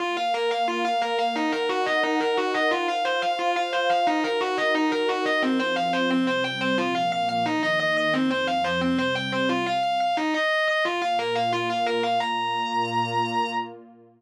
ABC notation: X:1
M:4/4
L:1/8
Q:1/4=177
K:Bbm
V:1 name="Distortion Guitar"
F f B f F f B f | E B G e E B G e | F f c f F f c f | E B G e E B G e |
[K:Fm] C c f c C c g c | F f f f E e e e | C c f c C c g c | F f f f E e e e |
[K:Bbm] F f B f F f B f | b8 |]
V:2 name="Pad 2 (warm)"
[B,Bf]8 | [EBg]8 | [Fcf]8 | [EGB]8 |
[K:Fm] [F,CF]4 [C,G,C]4 | [B,,F,B,]4 [E,B,E]4 | [F,,F,C]4 [C,G,C]4 | z8 |
[K:Bbm] [B,,B,F]8 | [B,,B,F]8 |]